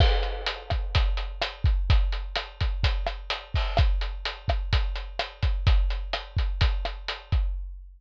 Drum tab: CC |x-------|--------|--------|--------|
HH |-xxxxxxx|xxxxxxxo|xxxxxxxx|xxxxxxxx|
SD |r--r--r-|--r--r--|r--r--r-|--r--r--|
BD |o--oo--o|o--oo--o|o--oo--o|o--oo--o|